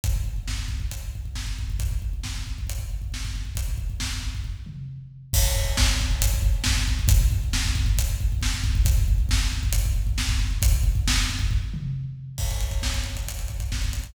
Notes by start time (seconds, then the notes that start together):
0.04 kick, closed hi-hat
0.16 kick
0.24 kick
0.36 kick
0.48 kick, snare
0.58 kick
0.68 kick
0.80 kick
0.91 kick, closed hi-hat
1.03 kick
1.15 kick
1.25 kick
1.35 kick, snare
1.47 kick
1.59 kick
1.70 kick
1.79 kick, closed hi-hat
1.91 kick
2.02 kick
2.13 kick
2.23 kick, snare
2.35 kick
2.47 kick
2.58 kick
2.67 kick, closed hi-hat
2.79 kick
2.90 kick
3.02 kick
3.12 kick, snare
3.25 kick
3.36 kick
3.45 kick
3.55 kick, closed hi-hat
3.69 kick
3.78 kick
3.90 kick
4.00 kick, snare
4.11 kick
4.23 kick
4.35 kick
4.44 kick, floor tom
4.66 mid tom
5.33 kick, crash
5.43 kick
5.55 kick
5.65 kick
5.77 kick, snare
5.89 kick
6.01 kick
6.11 kick
6.22 kick, closed hi-hat
6.34 kick
6.42 kick
6.64 kick, snare
6.77 kick
6.88 kick
6.99 kick
7.08 kick, closed hi-hat
7.21 kick
7.32 kick
7.44 kick
7.53 kick, snare
7.65 kick
7.75 kick
7.86 kick
7.98 kick, closed hi-hat
8.09 kick
8.20 kick
8.32 kick
8.41 kick, snare
8.54 kick
8.64 kick
8.75 kick
8.85 kick, closed hi-hat
8.97 kick
9.08 kick
9.18 kick
9.29 kick, snare
9.40 kick
9.53 kick
9.63 kick
9.73 kick, closed hi-hat
9.85 kick
9.96 kick
10.07 kick
10.18 kick, snare
10.29 kick
10.39 kick
10.51 kick
10.62 kick, closed hi-hat
10.72 kick
10.83 kick
10.95 kick
11.08 kick, snare
11.17 kick
11.30 kick
11.39 kick
11.51 kick, floor tom
11.74 mid tom
12.38 kick, crash
12.51 kick, closed hi-hat
12.60 kick, closed hi-hat
12.71 kick, closed hi-hat
12.82 kick, snare
12.94 kick, closed hi-hat
13.04 kick, closed hi-hat
13.15 kick, closed hi-hat
13.27 kick, closed hi-hat
13.39 kick, closed hi-hat
13.48 kick, closed hi-hat
13.60 kick, closed hi-hat
13.72 kick, snare
13.82 kick, closed hi-hat
13.93 kick, closed hi-hat
14.03 kick, closed hi-hat